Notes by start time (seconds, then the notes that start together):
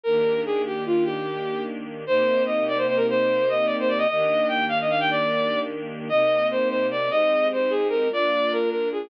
0.03 D#3 A#3 D4 G4 A#4
0.45 G#4
0.67 G4
0.86 F4
1.04 G4
2.07 C3 A#3 D#4 G4 C5
2.46 D#5
2.68 D5
2.77 C5
2.88 C5
2.97 A#4
3.09 C5
3.49 D#5
3.66 D5
3.79 C5
3.88 D5
3.98 D#5
4.08 D#3 A#3 D4 G4 D#5
4.48 G5
4.69 F5
4.81 D#5
4.90 F5
5.00 G5
5.10 D5
6.09 C3 A#3 D#4 G4 D#5
6.51 C5
6.69 C5
6.91 D5
7.08 G#3 C4 D#4 G4 D#5
7.53 C5
7.70 G#4
7.89 A#4
8.10 A#3 D4 F4 D5
8.52 A#4
8.70 A#4
8.92 G#4